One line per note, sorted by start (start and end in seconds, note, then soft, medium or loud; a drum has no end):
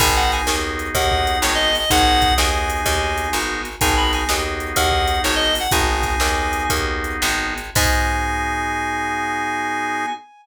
0.00 0.42 G#1 loud
0.00 1.71 B3 loud
0.00 1.71 D#4 loud
0.00 1.71 F#4 loud
0.00 1.71 G#4 loud
0.00 0.15 G#5 loud
0.00 kick medium
0.00 crash loud
0.16 0.31 F#5 medium
0.32 0.47 G#5 medium
0.32 snare soft
0.32 closed hi-hat medium
0.47 0.90 D#2 medium
0.47 snare loud
0.79 closed hi-hat medium
0.95 1.37 D#2 loud
0.95 1.39 F#5 medium
0.95 kick medium
0.95 closed hi-hat medium
1.12 kick medium
1.27 closed hi-hat medium
1.42 1.85 G#1 medium
1.42 1.54 C#5 medium
1.42 snare loud
1.55 1.76 D#5 medium
1.75 1.90 D#5 medium
1.75 open hi-hat medium
1.90 2.33 G#1 loud
1.90 3.62 B3 loud
1.90 3.62 D#4 loud
1.90 3.62 F#4 medium
1.90 3.62 G#4 loud
1.90 2.34 F#5 loud
1.90 kick loud
1.90 closed hi-hat loud
2.22 kick medium
2.22 snare soft
2.22 closed hi-hat medium
2.38 2.81 D#2 medium
2.38 3.31 G#5 medium
2.38 snare loud
2.70 closed hi-hat medium
2.86 3.29 D#2 loud
2.86 kick medium
2.86 closed hi-hat medium
3.18 closed hi-hat medium
3.33 3.76 G#1 medium
3.33 snare medium
3.65 closed hi-hat medium
3.81 4.24 G#1 loud
3.81 5.52 B3 loud
3.81 5.52 D#4 loud
3.81 5.52 F#4 loud
3.81 5.52 G#4 loud
3.81 3.96 G#5 loud
3.81 kick loud
3.81 closed hi-hat loud
3.97 4.12 B5 medium
4.13 4.28 G#5 medium
4.13 snare medium
4.13 closed hi-hat medium
4.29 4.72 D#2 medium
4.29 snare loud
4.60 closed hi-hat medium
4.76 5.19 D#2 loud
4.76 5.21 F#5 medium
4.76 kick medium
4.76 closed hi-hat loud
4.92 kick medium
5.08 closed hi-hat medium
5.24 5.67 G#1 medium
5.24 5.35 C#5 medium
5.24 snare medium
5.35 5.55 D#5 medium
5.55 open hi-hat medium
5.60 5.71 F#5 medium
5.71 6.16 G#1 loud
5.71 7.54 B3 loud
5.71 7.54 D#4 loud
5.71 7.54 F#4 medium
5.71 7.54 G#4 loud
5.71 6.63 G#5 loud
5.71 kick loud
5.71 closed hi-hat loud
6.03 kick medium
6.03 snare medium
6.03 closed hi-hat medium
6.20 6.66 D#2 medium
6.20 snare loud
6.53 closed hi-hat medium
6.70 7.17 D#2 medium
6.70 kick medium
6.70 closed hi-hat loud
7.04 closed hi-hat medium
7.22 7.71 G#1 medium
7.22 snare loud
7.58 closed hi-hat medium
7.75 10.06 G#2 loud
7.75 10.06 B3 loud
7.75 10.06 D#4 loud
7.75 10.06 F#4 loud
7.75 10.06 G#4 loud
7.75 10.06 G#5 loud
7.75 kick loud
7.75 crash loud